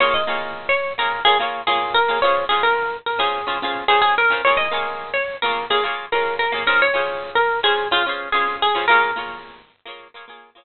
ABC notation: X:1
M:4/4
L:1/16
Q:1/4=108
K:Bbm
V:1 name="Acoustic Guitar (steel)"
d e4 d2 B2 A z2 A2 B2 | d2 A B3 B A5 A A B2 | d e4 d2 B2 A z2 B2 B2 | B d4 B2 A2 F z2 A2 A2 |
B10 z6 |]
V:2 name="Acoustic Guitar (steel)"
[B,FA]2 [B,FAd]5 [B,FAd]2 [B,Fd] [B,FAd]2 [B,Fd]3 [B,FAd] | [DFAc]2 [DFc]5 [DFc]2 [DFAc] [DFAc]2 [DFc]3 [DFAc] | [B,FA]2 [B,FAd]5 [B,FAd]2 [B,Fd] [B,FAd]2 [B,FAd]3 [B,FAd] | [DFAc]2 [DFAc]5 [DFc]2 [DAc] [DFAc]2 [DFc]3 [DFAc] |
[B,FAd]2 [B,FAd]5 [B,FAd]2 [B,FAd] [B,FAd]2 [B,FAd]3 z |]